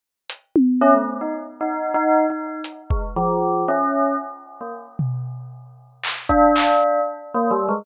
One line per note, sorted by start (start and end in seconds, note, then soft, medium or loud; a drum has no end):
0.30 closed hi-hat medium
0.56 high tom loud
0.81 0.93 C#4 loud
0.81 cowbell medium
0.94 1.17 A3 medium
1.21 1.33 D#4 medium
1.61 1.92 D#4 medium
1.94 2.26 D#4 loud
2.30 2.61 D#4 medium
2.64 closed hi-hat medium
2.90 3.02 G#3 medium
2.90 kick medium
3.16 3.63 F3 loud
3.68 4.15 C#4 medium
4.61 4.72 A#3 medium
4.99 floor tom medium
6.03 clap medium
6.29 7.00 D4 loud
6.29 kick medium
6.56 clap loud
7.34 7.50 A#3 medium
7.51 7.67 G3 loud
7.69 7.84 G#3 medium